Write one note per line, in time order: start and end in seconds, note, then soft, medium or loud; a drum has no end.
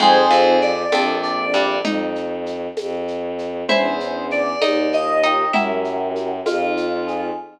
0.00 0.28 F2 medium
0.00 0.85 F2 loud
0.00 0.28 F3 medium
0.00 0.82 C4 loud
0.00 0.82 D#4 loud
0.00 0.82 F4 medium
0.00 0.82 G#4 loud
0.00 0.59 G#4 medium
0.00 0.59 C5 loud
0.00 low conga loud
0.00 shaker medium
0.31 0.83 F2 medium
0.31 0.83 F3 medium
0.31 shaker medium
0.61 1.16 D5 medium
0.61 shaker medium
0.92 1.78 A#1 loud
0.92 1.45 F2 medium
0.92 1.45 F3 medium
0.92 1.76 A#3 loud
0.92 1.76 C4 loud
0.92 1.76 D4 loud
0.92 1.76 A4 loud
0.92 tambourine loud
0.92 high conga loud
0.92 shaker medium
1.22 1.76 D5 medium
1.22 shaker medium
1.54 1.79 G2 medium
1.54 1.79 G3 medium
1.54 shaker medium
1.83 2.68 F2 loud
1.83 3.51 D#4 medium
1.83 low conga loud
1.83 shaker loud
2.15 shaker medium
2.46 shaker medium
2.77 3.64 F2 loud
2.77 tambourine medium
2.77 high conga medium
2.77 shaker medium
3.08 shaker medium
3.38 shaker medium
3.68 4.54 E2 loud
3.68 4.52 C#4 loud
3.68 4.52 D4 loud
3.68 4.52 E4 loud
3.68 4.59 E4 medium
3.68 4.52 G#4 loud
3.68 4.25 C5 medium
3.68 4.59 E5 medium
3.68 low conga loud
3.68 shaker medium
4.00 shaker medium
4.31 4.91 D5 medium
4.31 shaker medium
4.61 5.46 D#2 loud
4.61 5.21 D#4 medium
4.61 5.50 D#4 loud
4.61 5.21 D#5 medium
4.61 tambourine medium
4.61 high conga loud
4.61 shaker medium
4.92 5.51 F4 medium
4.92 5.48 D#5 medium
4.92 shaker medium
5.23 5.52 D#4 medium
5.23 5.54 G4 medium
5.23 5.52 D#5 medium
5.23 shaker medium
5.53 6.40 F#2 loud
5.53 6.54 E4 medium
5.53 6.37 E4 loud
5.53 6.37 F#4 loud
5.53 6.37 G4 loud
5.53 6.37 A#4 loud
5.53 6.54 E5 medium
5.53 low conga loud
5.53 shaker medium
5.84 shaker medium
6.16 shaker medium
6.45 7.30 F2 loud
6.45 7.34 D#4 loud
6.45 7.25 F4 medium
6.45 tambourine medium
6.45 high conga loud
6.45 shaker loud
6.77 7.35 F4 medium
6.77 shaker medium
7.07 7.36 G#4 loud
7.07 shaker medium